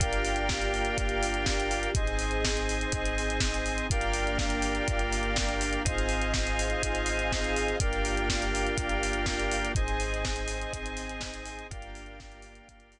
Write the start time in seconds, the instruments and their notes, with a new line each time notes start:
0.00 synth bass 2 G1, drawbar organ A#3 D4 F4 G4, string ensemble 1 A#3 D4 F4 G4, lead 1 (square) A#4 D5 F5 G5, kick, closed hi-hat
0.13 closed hi-hat
0.25 open hi-hat
0.36 closed hi-hat
0.49 kick, snare
0.62 closed hi-hat
0.74 open hi-hat
0.85 closed hi-hat
0.98 synth bass 2 G1, kick, closed hi-hat
1.09 closed hi-hat
1.23 open hi-hat
1.34 closed hi-hat
1.46 kick, snare
1.60 closed hi-hat
1.71 open hi-hat
1.83 closed hi-hat
1.95 synth bass 2 G#1, string ensemble 1 C4 D#4 G#4, drawbar organ C4 D#4 G#4, lead 1 (square) C5 D#5 G#5, kick, closed hi-hat
2.07 closed hi-hat
2.19 open hi-hat
2.31 closed hi-hat
2.45 kick, snare
2.57 closed hi-hat
2.69 open hi-hat
2.81 closed hi-hat
2.92 synth bass 2 G#1, kick, closed hi-hat
3.05 closed hi-hat
3.18 open hi-hat
3.30 closed hi-hat
3.40 kick, snare
3.54 closed hi-hat
3.66 open hi-hat
3.78 closed hi-hat
3.90 synth bass 2 G1, string ensemble 1 A#3 D4 F4 G4, drawbar organ A#3 D4 F4 G4, lead 1 (square) A#4 D5 F5 G5, kick, closed hi-hat
4.01 closed hi-hat
4.14 open hi-hat
4.27 closed hi-hat
4.39 kick, snare
4.50 closed hi-hat
4.62 open hi-hat
4.75 closed hi-hat
4.88 synth bass 2 G1, kick, closed hi-hat
4.99 closed hi-hat
5.13 open hi-hat
5.23 closed hi-hat
5.36 kick, snare
5.49 closed hi-hat
5.61 open hi-hat
5.73 closed hi-hat
5.84 synth bass 2 G#1, string ensemble 1 C4 D#4 F4 G#4, drawbar organ C4 D#4 F4 G#4, lead 1 (square) C5 D#5 F5 G#5, kick, closed hi-hat
5.98 closed hi-hat
6.09 open hi-hat
6.22 closed hi-hat
6.34 kick, snare
6.47 closed hi-hat
6.59 open hi-hat
6.70 closed hi-hat
6.83 synth bass 2 G#1, kick, closed hi-hat
6.95 closed hi-hat
7.06 open hi-hat
7.19 closed hi-hat
7.32 kick, snare
7.44 closed hi-hat
7.56 open hi-hat
7.68 closed hi-hat
7.80 synth bass 2 G1, drawbar organ A#3 D4 F4 G4, string ensemble 1 A#3 D4 F4 G4, lead 1 (square) A#4 D5 F5 G5, kick, closed hi-hat
7.93 closed hi-hat
8.05 open hi-hat
8.17 closed hi-hat
8.29 kick, snare
8.42 closed hi-hat
8.55 open hi-hat
8.67 closed hi-hat
8.78 synth bass 2 G1, kick, closed hi-hat
8.89 closed hi-hat
9.03 open hi-hat
9.13 closed hi-hat
9.26 kick, snare
9.40 closed hi-hat
9.51 open hi-hat
9.65 closed hi-hat
9.75 synth bass 2 G#1, string ensemble 1 C4 D#4 G#4, drawbar organ C4 D#4 G#4, lead 1 (square) C5 D#5 G#5, kick, closed hi-hat
9.88 closed hi-hat
10.00 open hi-hat
10.14 closed hi-hat
10.25 kick, snare
10.36 closed hi-hat
10.48 open hi-hat
10.61 closed hi-hat
10.73 synth bass 2 G#1, kick, closed hi-hat
10.86 closed hi-hat
10.97 open hi-hat
11.09 closed hi-hat
11.21 kick, snare
11.34 closed hi-hat
11.46 open hi-hat
11.59 closed hi-hat
11.71 synth bass 2 G1, drawbar organ A#3 D4 F4 G4, string ensemble 1 A#3 D4 F4 G4, lead 1 (square) A#4 D5 F5 G5, kick, closed hi-hat
11.82 closed hi-hat
11.95 open hi-hat
12.06 closed hi-hat
12.20 kick, snare
12.32 closed hi-hat
12.42 open hi-hat
12.55 closed hi-hat
12.68 synth bass 2 G1, kick, closed hi-hat
12.80 closed hi-hat
12.92 open hi-hat